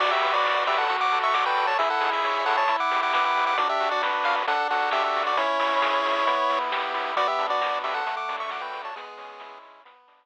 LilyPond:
<<
  \new Staff \with { instrumentName = "Lead 1 (square)" } { \time 4/4 \key b \minor \tempo 4 = 134 <fis' d''>16 <g' e''>8 <fis' d''>8. <g' e''>16 <a' fis''>8 <fis'' d'''>8 <e'' cis'''>16 <fis'' d'''>16 <b' g''>8 <cis'' a''>16 | <gis' e''>16 <a' fis''>8 <gis' e''>8. <a' fis''>16 <cis'' a''>8 <fis'' d'''>8 <fis'' d'''>16 <fis'' d'''>16 <fis'' d'''>8 <fis'' d'''>16 | <fis' d''>16 <g' e''>8 <fis' d''>16 r8 eis''16 r16 <a' fis''>8 <a' fis''>8 <g' e''>16 <g' e''>8 <fis' d''>16 | <e' cis''>2. r4 |
<fis' d''>16 <g' e''>8 <fis' d''>8. <g' e''>16 <a' fis''>8 <fis'' d'''>8 <e'' cis'''>16 <fis'' d'''>16 <b' g''>8 <cis'' a''>16 | <b gis'>4. r2 r8 | }
  \new Staff \with { instrumentName = "Lead 1 (square)" } { \time 4/4 \key b \minor fis'8 b'8 d''8 b'8 fis'8 a'8 d''8 a'8 | e'8 gis'8 cis''8 gis'8 e'8 g'8 b'8 g'8 | d'8 fis'8 b'8 fis'8 d'8 fis'8 a'8 fis'8 | cis'8 e'8 gis'8 e'8 b8 e'8 g'8 e'8 |
b8 d'8 fis'8 d'8 a8 d'8 fis'8 d'8 | gis8 cis'8 e'8 cis'8 b8 d'8 r4 | }
  \new Staff \with { instrumentName = "Synth Bass 1" } { \clef bass \time 4/4 \key b \minor b,,8 b,,8 b,,8 b,,8 d,8 d,8 d,8 d,8 | cis,8 cis,8 cis,8 cis,8 e,8 e,8 e,8 e,8 | b,,8 b,,8 b,,8 b,,8 d,8 d,8 d,8 d,8 | cis,8 cis,8 cis,8 cis,8 e,8 e,8 e,8 e,8 |
b,,8 b,,8 b,,8 b,,8 d,8 d,8 d,8 d,8 | cis,8 cis,8 cis,8 cis,8 b,,8 b,,8 r4 | }
  \new DrumStaff \with { instrumentName = "Drums" } \drummode { \time 4/4 <cymc bd>8 hho8 <bd sn>8 hho8 <hh bd>8 <hho sn>8 <bd sn>8 hho8 | <hh bd>8 hho8 <bd sn>8 hho8 <hh bd>8 <hho sn>8 <bd sn>8 hho8 | <hh bd>8 hho8 <bd sn>8 hho8 <hh bd>8 <hho sn>8 <bd sn>8 hho8 | <hh bd>8 hho8 <bd sn>8 hho8 <hh bd>8 <hho sn>8 <bd sn>8 hho8 |
<hh bd>8 hho8 <bd sn>8 hho8 <hh bd>8 <hho sn>8 <bd sn>8 hho8 | <hh bd>8 hho8 <bd sn>8 hho8 <hh bd>8 <hho sn>8 r4 | }
>>